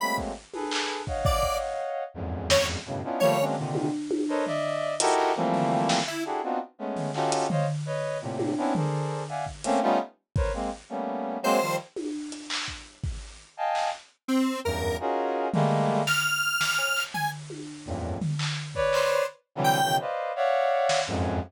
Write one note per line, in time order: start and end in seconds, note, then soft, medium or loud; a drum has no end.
0.00 0.32 F#3 medium
0.00 0.32 G#3 medium
0.00 0.32 A3 medium
0.00 0.32 A#3 medium
0.00 0.32 C4 medium
0.00 0.17 B5 medium
0.18 kick medium
0.54 1.02 G#4 medium
0.54 1.02 A4 medium
0.54 1.02 B4 medium
0.54 high tom medium
0.71 clap loud
1.07 2.03 C#5 medium
1.07 2.03 D#5 medium
1.07 2.03 F5 medium
1.07 2.03 F#5 medium
1.07 kick medium
1.25 1.58 D5 medium
1.25 kick loud
1.43 kick medium
2.14 2.78 E2 medium
2.14 2.78 F2 medium
2.14 2.78 F#2 medium
2.14 2.78 G#2 medium
2.50 2.67 C#5 loud
2.50 snare loud
2.86 3.02 F#2 medium
2.86 3.02 G2 medium
2.86 3.02 A2 medium
2.86 3.02 B2 medium
2.86 3.02 C#3 medium
3.04 3.20 B3 medium
3.04 3.20 C#4 medium
3.04 3.20 D4 medium
3.04 3.20 D#4 medium
3.04 3.20 E4 medium
3.04 3.20 F4 medium
3.20 3.38 F3 loud
3.20 3.38 G3 loud
3.20 3.38 A3 loud
3.20 3.38 A#3 loud
3.20 3.44 C#5 loud
3.20 floor tom medium
3.39 3.55 F#3 medium
3.39 3.55 G#3 medium
3.39 3.55 A#3 medium
3.39 3.55 C4 medium
3.39 3.55 C#4 medium
3.39 3.55 D4 medium
3.57 3.89 A#2 medium
3.57 3.89 C3 medium
3.57 3.89 D3 medium
3.57 3.89 D#3 medium
3.75 high tom medium
4.11 high tom medium
4.29 4.45 A4 medium
4.29 4.45 A#4 medium
4.29 4.45 B4 medium
4.29 4.45 C5 medium
4.29 4.45 C#5 medium
4.29 4.45 D#5 medium
4.46 4.95 D5 loud
4.46 4.95 D#5 loud
4.46 4.95 E5 loud
4.46 floor tom medium
5.00 5.32 D#4 loud
5.00 5.32 E4 loud
5.00 5.32 F#4 loud
5.00 5.32 G4 loud
5.00 5.32 A4 loud
5.00 5.32 A#4 loud
5.00 closed hi-hat loud
5.18 clap medium
5.36 6.00 E3 medium
5.36 6.00 F3 medium
5.36 6.00 G3 medium
5.36 6.00 A3 medium
5.36 6.00 A#3 medium
5.36 6.00 C4 medium
5.54 floor tom medium
5.89 snare medium
6.08 6.24 E4 medium
6.25 6.41 D4 medium
6.25 6.41 E4 medium
6.25 6.41 F#4 medium
6.25 6.41 G4 medium
6.25 6.41 G#4 medium
6.25 6.41 A4 medium
6.43 6.59 B3 medium
6.43 6.59 C4 medium
6.43 6.59 D4 medium
6.43 6.59 D#4 medium
6.43 6.59 F4 medium
6.43 6.59 F#4 medium
6.78 7.11 G#3 medium
6.78 7.11 A3 medium
6.78 7.11 B3 medium
6.78 7.11 C#4 medium
6.96 floor tom medium
7.14 7.46 C#4 medium
7.14 7.46 D#4 medium
7.14 7.46 F4 medium
7.14 7.46 F#4 medium
7.14 7.46 G4 medium
7.14 7.46 A4 medium
7.14 clap medium
7.32 closed hi-hat medium
7.50 7.66 C5 medium
7.50 7.66 C#5 medium
7.50 7.66 D#5 medium
7.50 7.66 F5 medium
7.50 floor tom loud
7.86 8.18 B4 medium
7.86 8.18 C#5 medium
7.86 8.18 D#5 medium
8.21 8.54 A2 medium
8.21 8.54 A#2 medium
8.21 8.54 C3 medium
8.39 high tom medium
8.57 8.73 B3 medium
8.57 8.73 C4 medium
8.57 8.73 C#4 medium
8.57 8.73 D4 medium
8.57 8.73 E4 medium
8.75 9.23 G#4 medium
8.75 9.23 A4 medium
8.75 9.23 A#4 medium
8.75 9.23 C5 medium
8.75 9.23 D5 medium
8.75 floor tom loud
9.29 9.45 D5 medium
9.29 9.45 E5 medium
9.29 9.45 F5 medium
9.29 9.45 F#5 medium
9.29 9.45 G#5 medium
9.46 kick medium
9.64 9.80 A3 loud
9.64 9.80 A#3 loud
9.64 9.80 C4 loud
9.64 9.80 C#4 loud
9.64 closed hi-hat medium
9.82 9.98 G3 loud
9.82 9.98 A3 loud
9.82 9.98 B3 loud
9.82 9.98 C#4 loud
9.82 9.98 D#4 loud
9.82 9.98 F4 loud
10.36 10.52 A#4 medium
10.36 10.52 B4 medium
10.36 10.52 C5 medium
10.36 10.52 C#5 medium
10.36 kick loud
10.54 10.70 G#3 medium
10.54 10.70 A#3 medium
10.54 10.70 C4 medium
10.89 11.38 G3 medium
10.89 11.38 A3 medium
10.89 11.38 A#3 medium
10.89 11.38 B3 medium
10.89 11.38 C#4 medium
11.43 11.59 F#3 loud
11.43 11.59 G#3 loud
11.43 11.59 A#3 loud
11.43 11.59 C4 loud
11.43 11.76 C5 loud
11.61 11.77 D#3 medium
11.61 11.77 F3 medium
11.61 11.77 G3 medium
11.61 clap medium
11.96 high tom medium
12.32 closed hi-hat medium
12.50 clap loud
12.68 kick medium
13.04 kick medium
13.57 13.89 D#5 medium
13.57 13.89 F5 medium
13.57 13.89 G5 medium
13.57 13.89 G#5 medium
13.57 13.89 A5 medium
13.75 clap medium
14.28 14.60 C4 medium
14.64 14.96 E2 medium
14.64 14.96 F#2 medium
14.64 14.96 G2 medium
14.64 14.97 A#4 medium
15.00 15.48 C#4 medium
15.00 15.48 D#4 medium
15.00 15.48 F4 medium
15.00 15.48 F#4 medium
15.00 15.48 G#4 medium
15.00 15.48 A#4 medium
15.53 16.02 G3 loud
15.53 16.02 G#3 loud
15.53 16.02 A3 loud
15.53 16.02 A#3 loud
15.53 floor tom loud
15.89 floor tom medium
16.07 17.03 F6 loud
16.07 snare medium
16.61 snare medium
16.79 cowbell medium
16.96 clap medium
17.14 17.30 G#5 medium
17.14 floor tom medium
17.50 high tom medium
17.86 18.18 E2 medium
17.86 18.18 F2 medium
17.86 18.18 F#2 medium
17.86 18.18 G2 medium
17.86 18.18 A2 medium
17.86 18.18 A#2 medium
18.21 floor tom loud
18.39 clap medium
18.75 19.23 B4 loud
18.75 19.23 C#5 loud
18.75 19.23 D5 loud
18.75 kick medium
18.93 19.26 C5 medium
18.93 clap medium
19.55 19.79 C3 medium
19.55 19.79 D3 medium
19.55 19.79 E3 medium
19.55 19.79 F#3 medium
19.55 19.79 G3 medium
19.64 19.96 G5 loud
19.82 19.98 B2 medium
19.82 19.98 C#3 medium
19.82 19.98 D#3 medium
19.82 19.98 E3 medium
19.82 19.98 F#3 medium
20.00 20.32 B4 medium
20.00 20.32 C5 medium
20.00 20.32 D5 medium
20.00 20.32 D#5 medium
20.00 20.32 F5 medium
20.36 21.00 C#5 loud
20.36 21.00 D5 loud
20.36 21.00 E5 loud
20.36 21.00 F5 loud
20.36 21.00 F#5 loud
20.89 snare medium
21.07 21.39 F2 loud
21.07 21.39 F#2 loud
21.07 21.39 G#2 loud